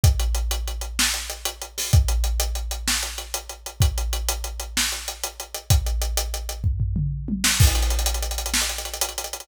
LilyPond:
\new DrumStaff \drummode { \time 12/8 \tempo 4. = 127 <hh bd>8 hh8 hh8 hh8 hh8 hh8 sn8 hh8 hh8 hh8 hh8 hho8 | <hh bd>8 hh8 hh8 hh8 hh8 hh8 sn8 hh8 hh8 hh8 hh8 hh8 | <hh bd>8 hh8 hh8 hh8 hh8 hh8 sn8 hh8 hh8 hh8 hh8 hh8 | <hh bd>8 hh8 hh8 hh8 hh8 hh8 <bd tomfh>8 tomfh8 toml8 r8 tommh8 sn8 |
<cymc bd>16 hh16 hh16 hh16 hh16 hh16 hh16 hh16 hh16 hh16 hh16 hh16 sn16 hh16 hh16 hh16 hh16 hh16 hh16 hh16 hh16 hh16 hh16 hh16 | }